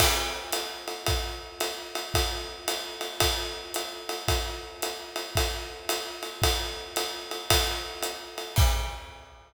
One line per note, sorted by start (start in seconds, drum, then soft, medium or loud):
0.00 kick medium
0.00 crash loud
0.00 ride loud
0.52 hi-hat pedal loud
0.52 ride loud
0.88 ride medium
1.06 kick medium
1.06 ride loud
1.60 hi-hat pedal medium
1.60 ride loud
1.95 ride medium
2.14 kick medium
2.14 ride loud
2.68 hi-hat pedal medium
2.68 ride loud
3.01 ride medium
3.20 kick medium
3.20 ride loud
3.74 hi-hat pedal loud
3.74 ride loud
4.09 ride medium
4.28 kick medium
4.28 ride loud
4.82 hi-hat pedal loud
4.82 ride loud
5.16 ride medium
5.35 kick medium
5.35 ride loud
5.89 hi-hat pedal loud
5.89 ride loud
6.23 ride medium
6.42 kick medium
6.42 ride loud
6.96 hi-hat pedal loud
6.96 ride loud
7.31 ride medium
7.50 kick medium
7.50 ride loud
8.03 hi-hat pedal loud
8.03 ride medium
8.38 ride medium
8.56 kick loud
8.56 crash loud